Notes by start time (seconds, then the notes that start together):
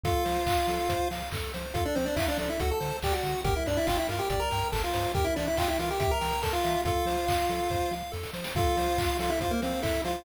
0.03 F2 F4 A4 F5, kick, closed hi-hat
0.25 F3 C5, open hi-hat
0.46 F2 F5, kick, clap
0.68 F3 A4, open hi-hat
0.89 F2 C5, kick, closed hi-hat
1.10 F3 F5, open hi-hat
1.31 F2 A4, kick, clap
1.53 F3 C5, open hi-hat
1.74 F2 F4 A4 F5, kick, closed hi-hat
1.85 D4 D5
1.95 F3 C4 C5, open hi-hat
2.06 D4 D5
2.16 E2 E4 E5 F5, kick, clap
2.28 D4 D5
2.38 F3 D4 A4 D5, open hi-hat
2.50 E4 E5
2.59 D2 F#4 A4 F#5, kick, closed hi-hat
2.71 A4 A5
2.80 D3 C5, open hi-hat
3.02 D2 G4 D5 G5, kick, clap
3.13 F#4 F#5
3.23 D3 F#5, open hi-hat
3.44 G1 G4 A#4 G5, kick, closed hi-hat
3.56 E4 E5
3.66 G2 D4 D5, open hi-hat
3.77 E4 E5
3.87 G1 F4 F5 G5, kick, clap
3.97 E4 E5
4.09 G2 F4 A#4 F5, open hi-hat
4.19 G4 G5
4.30 G1 G4 D5 G5, kick, closed hi-hat
4.40 A#4 A#5
4.51 G2 G5, open hi-hat
4.72 G1 A4 A#4 A5, kick, clap
4.84 F4 F5
4.93 G2 C5, open hi-hat
5.14 E2 G4 A#4 G5, kick, closed hi-hat
5.24 E4 E5
5.36 E3 D4 D5 E5, open hi-hat
5.48 E4 E5
5.57 E2 F4 F5 G5, kick, clap
5.68 E4 E5
5.79 E3 F4 A#4 F5, open hi-hat
5.90 G4 G5
5.99 E2 G4 E5 G5, kick, closed hi-hat
6.11 A#4 A#5
6.21 E3 G5, open hi-hat
6.42 E2 A4 A#4 A5, kick, clap
6.53 F4 F5
6.64 E3 E5, open hi-hat
6.85 F2 F4 A4 F5, kick, closed hi-hat
7.06 F3 C5, open hi-hat
7.27 F2 F5, kick, clap
7.49 F3 A4, open hi-hat
7.70 F2 C5, kick, snare
7.91 F3 F5, snare
8.12 F2 A4, snare
8.23 snare
8.33 F3 C5, snare
8.44 snare
8.55 F2 F4 A4 F5, kick, closed hi-hat
8.77 F3 C5, open hi-hat
8.98 F2 F5, kick, clap
9.19 F3 F4 A4 F5, open hi-hat
9.30 E4 E5
9.41 F2 F4 C5 F5, kick, closed hi-hat
9.51 A#3 A#4
9.62 F3 C4 C5 F5, open hi-hat
9.82 F2 E4 A4 E5, kick, clap
10.04 F3 F4 C5 F5, open hi-hat